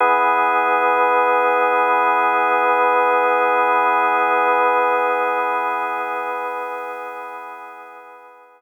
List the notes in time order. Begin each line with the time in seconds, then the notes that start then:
0.00 E3 B3 G#4